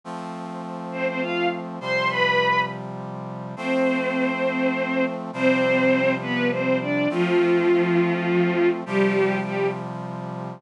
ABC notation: X:1
M:3/4
L:1/16
Q:1/4=102
K:Flyd
V:1 name="Violin"
z6 [Cc] [Cc] [Ff]2 z2 | [cc']2 [Bb]4 z6 | [Cc]12 | [Cc]6 [B,B]2 [Cc]2 [Dd]2 |
[F,F]12 | [G,G]4 [G,G]2 z6 |]
V:2 name="Brass Section"
[F,A,C]12 | [C,F,G,]12 | [F,A,C]12 | [C,F,G,]12 |
[F,A,C]12 | [C,F,G,]12 |]